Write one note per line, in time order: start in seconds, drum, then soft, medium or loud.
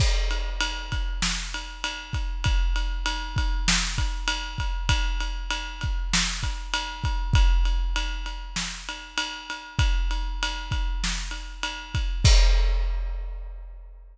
0.00 kick medium
0.00 crash medium
0.31 ride medium
0.61 ride medium
0.92 kick medium
0.92 ride medium
1.22 snare medium
1.54 ride medium
1.84 ride medium
2.13 kick medium
2.13 ride medium
2.44 kick medium
2.44 ride medium
2.76 ride medium
3.06 ride medium
3.36 kick medium
3.36 ride medium
3.68 snare loud
3.98 kick medium
3.98 ride medium
4.28 ride medium
4.58 kick medium
4.58 ride medium
4.89 kick medium
4.89 ride medium
5.20 ride medium
5.51 ride medium
5.81 kick medium
5.81 ride medium
6.14 snare loud
6.43 kick medium
6.43 ride medium
6.74 ride medium
7.04 kick medium
7.04 ride medium
7.33 kick loud
7.33 ride medium
7.65 ride medium
7.96 ride medium
8.26 ride medium
8.56 snare medium
8.89 ride medium
9.18 ride medium
9.50 ride medium
9.79 kick medium
9.79 ride medium
10.11 ride medium
10.43 ride medium
10.71 kick medium
10.71 ride medium
11.04 snare medium
11.31 ride medium
11.63 ride medium
11.95 kick medium
11.95 ride medium
12.24 kick loud
12.24 crash loud